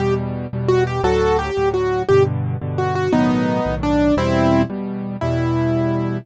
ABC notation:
X:1
M:6/8
L:1/8
Q:3/8=115
K:Em
V:1 name="Acoustic Grand Piano"
G z3 F G | [FA]2 G2 F2 | G z3 F F | [B,^D]4 =D2 |
[CE]3 z3 | E6 |]
V:2 name="Acoustic Grand Piano" clef=bass
[E,,B,,G,]3 [E,,B,,G,]3 | [D,,A,,F,]3 [D,,A,,F,]3 | [G,,B,,D,]3 [G,,B,,D,]3 | [B,,,A,,^D,F,]3 [B,,,A,,D,F,]3 |
[E,,B,,G,]3 [E,,B,,G,]3 | [E,,B,,G,]6 |]